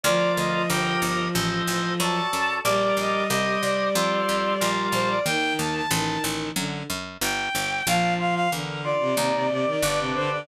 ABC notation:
X:1
M:4/4
L:1/16
Q:1/4=92
K:Gm
V:1 name="Violin"
d2 e e g2 z6 a4 | d2 e e e2 d8 c d | g2 a a a2 z6 g4 | f2 f f z2 d8 c d |]
V:2 name="Violin" clef=bass
F,16 | G,16 | E,4 E,4 D,2 z6 | F,4 D,3 C, C, C, C, E, z C, D, D, |]
V:3 name="Drawbar Organ"
[FBd]4 [GBe]4 [Ace]4 [^FAd]4 | [GBd]4 [Gce]4 [FAc]4 [FBd]4 | z16 | D2 F2 B2 F2 E2 G2 [DG=B]4 |]
V:4 name="Harpsichord" clef=bass
D,,2 D,,2 G,,,2 G,,,2 A,,,2 A,,,2 ^F,,2 F,,2 | B,,,2 B,,,2 C,,2 C,,2 F,,2 F,,2 B,,,2 B,,,2 | E,,2 E,,2 A,,,2 A,,,2 ^F,,2 F,,2 G,,,2 G,,,2 | B,,,4 =E,,4 _E,,4 G,,,4 |]